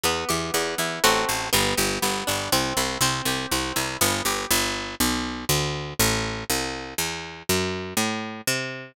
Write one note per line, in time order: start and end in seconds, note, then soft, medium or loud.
0.04 0.25 E2 medium
0.04 0.53 B3 loud
0.29 0.51 E2 medium
0.29 0.99 G4 medium
0.54 0.75 E2 medium
0.54 1.01 B3 medium
0.78 0.99 E2 medium
0.78 1.03 E4 medium
1.04 1.25 A1 medium
1.04 1.48 A3 loud
1.04 1.48 C4 medium
1.04 1.48 F#4 loud
1.29 1.50 A1 medium
1.53 1.74 G1 loud
1.53 2.02 B3 loud
1.77 1.99 G1 medium
1.77 2.48 G4 medium
2.02 2.24 G1 medium
2.02 2.49 B3 medium
2.27 2.49 G1 medium
2.27 2.51 D4 medium
2.52 2.73 C2 medium
2.52 2.99 C4 loud
2.77 2.98 C2 medium
2.77 3.01 E4 medium
3.01 3.22 C2 medium
3.01 3.51 C4 loud
3.25 3.46 C2 medium
3.25 3.98 G4 medium
3.51 3.73 C2 medium
3.51 3.99 C4 medium
3.76 3.97 C2 medium
3.76 3.99 E4 medium
4.01 4.22 G1 loud
4.01 4.48 B3 loud
4.25 4.46 G1 medium
4.25 4.50 G4 medium
4.51 4.95 G1 loud
5.00 5.45 B1 loud
5.49 5.94 D2 loud
5.99 6.44 A1 loud
6.50 6.94 C2 medium
6.98 7.43 E2 medium
7.49 7.94 F#2 loud
7.97 8.41 A2 medium
8.47 8.92 C3 loud